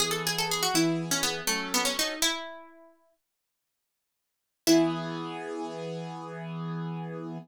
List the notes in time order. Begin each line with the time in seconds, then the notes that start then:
0.00 E3 B3 G#4
0.11 A4
0.27 G#4
0.38 A4
0.51 G#4
0.63 F#4
0.74 E3 B3 E4 G#4
1.11 C#4
1.23 B3
1.47 F#3 A3 C#4 A4
1.74 B3
1.85 C#4
1.99 D#4
2.22 E4
4.67 E3 B3 E4 G#4